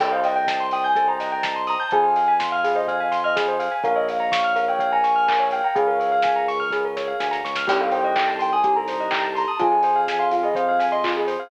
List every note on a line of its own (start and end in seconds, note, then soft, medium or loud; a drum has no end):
0.00 1.76 C2 loud
0.00 0.11 A4 medium
0.00 0.86 C5 loud
0.00 0.86 D#5 loud
0.00 0.11 G5 medium
0.00 0.86 G5 medium
0.00 0.86 A5 medium
0.00 kick medium
0.00 crash medium
0.12 0.23 C5 medium
0.12 0.23 F5 medium
0.24 0.35 D#5 medium
0.24 0.63 G5 medium
0.24 open hi-hat medium
0.36 0.47 G5 medium
0.47 0.59 A5 medium
0.47 kick medium
0.47 snare medium
0.60 0.71 C6 medium
0.71 0.83 G5 medium
0.71 0.84 D#6 medium
0.71 open hi-hat medium
0.84 1.08 G#5 medium
0.84 0.95 G6 medium
0.96 1.07 A4 medium
0.96 1.82 C5 medium
0.96 1.82 D#5 medium
0.96 1.82 G5 medium
0.96 1.82 A5 medium
0.96 kick medium
0.96 closed hi-hat medium
1.08 1.19 C5 medium
1.08 1.62 A#5 medium
1.20 1.31 D#5 medium
1.20 snare medium
1.20 open hi-hat medium
1.32 1.43 G5 medium
1.43 1.54 A5 medium
1.43 kick medium
1.43 snare medium
1.56 1.67 C6 medium
1.67 1.80 A#5 loud
1.67 1.78 D#6 medium
1.67 open hi-hat medium
1.80 1.92 A5 medium
1.80 1.91 G6 medium
1.91 3.69 F2 loud
1.91 2.04 G#4 medium
1.91 2.78 C5 medium
1.91 2.78 F5 medium
1.91 2.78 G#5 medium
1.91 2.33 G#5 loud
1.91 kick medium
1.91 closed hi-hat medium
2.03 2.14 C5 medium
2.16 2.27 F5 medium
2.16 open hi-hat medium
2.28 2.39 G#5 medium
2.40 2.50 C6 medium
2.40 kick medium
2.40 snare loud
2.52 2.63 F5 medium
2.52 2.63 F6 medium
2.64 2.75 G#4 medium
2.64 2.75 F5 medium
2.64 open hi-hat medium
2.75 2.86 C5 medium
2.75 2.87 D#5 medium
2.87 3.74 C5 medium
2.87 3.17 F5 medium
2.87 3.74 F5 medium
2.87 2.99 F5 medium
2.87 3.74 G#5 medium
2.87 kick medium
2.87 closed hi-hat medium
3.00 3.11 G#5 medium
3.12 3.22 C6 medium
3.12 snare medium
3.12 open hi-hat medium
3.24 3.36 D#5 medium
3.24 3.35 F6 medium
3.36 3.47 G#4 medium
3.36 kick medium
3.36 snare medium
3.48 3.59 C5 medium
3.59 3.70 F5 medium
3.59 open hi-hat medium
3.71 3.82 G#5 medium
3.83 5.61 A#1 loud
3.83 4.70 A#4 loud
3.83 3.95 A#4 medium
3.83 4.70 C#5 medium
3.83 4.70 F5 loud
3.83 3.96 F5 medium
3.83 kick medium
3.83 closed hi-hat medium
3.96 4.06 C#5 medium
3.96 4.07 D#5 medium
4.08 4.19 F5 medium
4.08 4.51 F5 medium
4.08 open hi-hat medium
4.20 4.31 A#5 medium
4.32 4.43 C#6 medium
4.32 kick medium
4.32 snare loud
4.44 4.55 F6 medium
4.56 4.66 A#4 medium
4.56 4.67 F5 medium
4.56 open hi-hat medium
4.68 4.79 C#5 medium
4.68 4.92 G5 medium
4.79 5.67 A#4 medium
4.79 5.67 C#5 medium
4.79 4.91 F5 medium
4.79 5.67 F5 medium
4.79 kick medium
4.79 closed hi-hat medium
4.91 5.45 G#5 medium
4.91 5.03 A#5 medium
5.04 5.15 C#6 soft
5.04 snare medium
5.04 open hi-hat medium
5.16 5.26 F6 medium
5.28 5.38 A#4 medium
5.28 kick medium
5.28 clap loud
5.40 5.50 C#5 medium
5.51 5.63 F5 medium
5.51 5.63 G5 medium
5.51 open hi-hat medium
5.64 5.76 G5 medium
5.64 5.75 A#5 medium
5.75 7.13 C#2 medium
5.75 5.86 G#4 medium
5.75 6.63 G#4 medium
5.75 6.63 A#4 medium
5.75 6.63 C#5 loud
5.75 6.45 F5 medium
5.75 6.63 F5 medium
5.75 kick loud
5.75 closed hi-hat medium
5.87 5.98 A#4 medium
6.00 6.10 C#5 medium
6.00 open hi-hat medium
6.12 6.23 F5 medium
6.22 6.35 G#5 medium
6.22 kick medium
6.22 snare medium
6.36 6.47 A#5 medium
6.48 6.59 C#6 medium
6.48 open hi-hat medium
6.60 6.71 F6 medium
6.70 7.57 G#4 medium
6.70 6.83 G#4 medium
6.70 7.57 A#4 medium
6.70 7.57 C#5 medium
6.70 7.57 F5 medium
6.70 kick medium
6.70 snare medium
6.85 6.96 A#4 medium
6.97 7.07 C#5 medium
6.97 snare medium
7.08 7.19 F5 medium
7.20 7.42 D2 medium
7.20 7.31 G#5 medium
7.20 snare medium
7.31 7.42 A#5 medium
7.31 snare medium
7.45 7.66 C#2 medium
7.45 7.55 C#6 medium
7.45 snare medium
7.55 7.67 F6 medium
7.55 snare medium
7.67 9.45 C2 loud
7.67 8.55 C4 loud
7.67 8.55 D#4 medium
7.67 7.78 G4 medium
7.67 8.55 G4 medium
7.67 8.55 A4 medium
7.67 7.80 G5 loud
7.67 kick loud
7.67 crash loud
7.80 7.91 A4 medium
7.80 7.92 F5 loud
7.91 8.03 C5 medium
7.91 8.30 G5 loud
7.91 open hi-hat medium
8.04 8.15 D#5 medium
8.16 8.27 G5 medium
8.16 kick medium
8.16 clap loud
8.28 8.38 A5 medium
8.39 8.53 G5 medium
8.39 8.50 C6 medium
8.39 open hi-hat medium
8.53 8.75 G#5 medium
8.53 8.63 D#6 medium
8.63 9.49 C4 medium
8.63 9.49 D#4 medium
8.63 9.49 G4 medium
8.63 8.75 G4 medium
8.63 9.49 A4 medium
8.63 kick medium
8.63 closed hi-hat loud
8.75 8.88 A4 medium
8.75 9.29 A#5 loud
8.88 8.99 C5 medium
8.88 snare soft
8.88 open hi-hat medium
9.00 9.11 D#5 medium
9.11 9.22 G5 medium
9.11 kick medium
9.11 clap loud
9.23 9.34 A5 medium
9.35 9.48 A#5 loud
9.35 9.46 C6 medium
9.35 open hi-hat medium
9.48 9.60 A5 loud
9.48 9.59 D#6 medium
9.59 11.37 F2 loud
9.59 10.47 C4 loud
9.59 9.70 F4 medium
9.59 10.47 F4 loud
9.59 10.47 G#4 loud
9.59 10.01 G#5 loud
9.59 kick loud
9.59 closed hi-hat medium
9.72 9.82 G#4 medium
9.83 9.94 C5 medium
9.83 open hi-hat medium
9.96 10.06 F5 medium
10.08 10.20 G#5 medium
10.08 kick medium
10.08 snare medium
10.19 10.31 F5 loud
10.19 10.30 C6 medium
10.31 10.43 F4 medium
10.31 10.43 F5 loud
10.31 open hi-hat medium
10.43 10.54 G#4 medium
10.43 10.56 D#5 medium
10.55 11.42 C4 medium
10.55 11.42 F4 medium
10.55 11.42 G#4 medium
10.55 10.66 C5 medium
10.55 10.86 F5 loud
10.55 kick medium
10.55 closed hi-hat medium
10.69 10.79 F5 medium
10.79 10.90 G#5 medium
10.79 snare medium
10.79 open hi-hat medium
10.92 11.03 D#5 medium
10.92 11.03 C6 medium
11.04 11.15 F4 medium
11.04 kick medium
11.04 clap medium
11.17 11.28 G#4 medium
11.27 11.38 C5 medium
11.27 open hi-hat medium
11.40 11.50 F5 medium